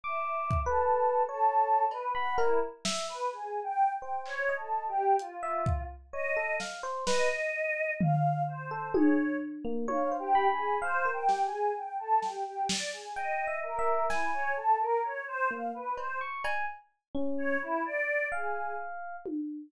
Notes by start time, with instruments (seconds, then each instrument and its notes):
0.04 choir aahs E5, electric piano 1 D6
0.51 kick
0.66 choir aahs A4, electric piano 1 B4
1.29 choir aahs A4, electric piano 1 C#5
1.91 choir aahs B4, cowbell
2.15 choir aahs F#5, electric piano 1 B5
2.38 choir aahs E4, electric piano 1 A#4, cowbell
2.85 electric piano 1 E5, snare
3.08 choir aahs B4
3.32 choir aahs G#4
3.63 choir aahs G5
3.94 choir aahs G5
4.02 electric piano 1 C5
4.26 choir aahs C#5, clap
4.49 electric piano 1 D#5
4.57 choir aahs A4
4.88 choir aahs G4
5.19 choir aahs F4, closed hi-hat
5.43 electric piano 1 E5
5.66 kick
6.13 electric piano 1 C#5, choir aahs D#5
6.37 electric piano 1 A4
6.60 electric piano 1 F5, snare
6.83 electric piano 1 C5
7.07 electric piano 1 B4, choir aahs D#5, snare
8.00 choir aahs F5, floor tom
8.47 choir aahs C5
8.71 electric piano 1 A4
8.94 electric piano 1 G#4, choir aahs C#5, high tom
9.65 electric piano 1 A#3
9.88 electric piano 1 C#5, choir aahs F5, high tom
10.11 electric piano 1 C5
10.19 choir aahs G4
10.35 electric piano 1 B5
10.50 choir aahs G#4
10.82 choir aahs C5, electric piano 1 F5
11.05 electric piano 1 A#4
11.13 choir aahs G5
11.29 electric piano 1 G4, snare
11.44 choir aahs G#4
11.76 choir aahs G5
11.99 choir aahs A4
12.22 choir aahs G4, snare
12.46 choir aahs G4
12.69 choir aahs D5, snare
12.93 choir aahs G#4
13.16 choir aahs D#5, electric piano 1 G5
13.47 electric piano 1 E5
13.63 choir aahs A#4
13.79 electric piano 1 E5
14.10 choir aahs E4, electric piano 1 G#5, snare
14.33 choir aahs C#5
14.57 choir aahs A4
14.80 choir aahs A#4
15.04 choir aahs C#5
15.27 choir aahs C5
15.51 electric piano 1 A#3, choir aahs F5
15.74 choir aahs B4
15.97 electric piano 1 C5, choir aahs C5, cowbell
16.21 electric piano 1 C#6
16.44 electric piano 1 G#5, cowbell
17.15 electric piano 1 C#4
17.38 choir aahs C#5
17.62 choir aahs E4
17.85 choir aahs D5
18.32 choir aahs G#4, electric piano 1 F5
19.26 high tom